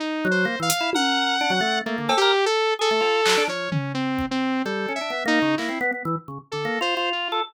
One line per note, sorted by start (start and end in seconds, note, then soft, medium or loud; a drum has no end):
0.00 0.27 D#4 medium
0.25 0.46 F#3 loud
0.31 0.59 C5 medium
0.45 0.56 A#3 medium
0.60 0.70 E3 medium
0.60 0.90 F5 medium
0.70 closed hi-hat medium
0.81 0.91 E4 medium
0.93 1.36 A#4 medium
0.93 1.79 F#5 medium
0.93 high tom medium
1.41 1.51 D4 loud
1.50 1.61 F#3 loud
1.61 1.81 A3 medium
1.86 1.97 A3 medium
1.86 2.14 A#3 medium
1.98 2.09 D3 medium
2.09 2.19 A4 loud
2.09 cowbell loud
2.17 2.45 G4 loud
2.22 2.32 A#4 loud
2.46 2.74 A4 loud
2.79 2.90 G#4 medium
2.79 3.44 A4 loud
2.91 3.01 A3 medium
3.00 3.21 F4 medium
3.00 cowbell medium
3.26 3.37 F#3 medium
3.26 clap loud
3.37 3.48 D4 loud
3.48 3.69 F3 medium
3.48 3.70 C#5 medium
3.72 3.92 C#4 medium
3.72 floor tom medium
3.94 4.26 C4 medium
4.19 kick soft
4.31 4.62 C4 loud
4.65 4.86 G3 medium
4.65 4.93 A4 medium
4.88 4.99 C#4 medium
4.96 5.23 E5 medium
5.01 5.11 D4 medium
5.10 5.24 B3 medium
5.25 5.39 A#3 loud
5.25 5.55 D#4 loud
5.42 5.56 C#3 medium
5.58 5.69 A#3 medium
5.58 5.78 E4 medium
5.58 clap medium
5.69 5.79 C4 medium
5.81 5.91 B3 loud
5.92 6.03 B3 medium
6.05 6.16 E3 loud
6.28 6.38 C#3 medium
6.52 6.67 D3 soft
6.52 6.79 A4 medium
6.65 6.79 A#3 medium
6.81 6.95 F4 loud
6.81 7.09 C5 medium
6.97 7.28 F4 loud
7.12 7.40 F4 medium
7.32 7.42 A4 loud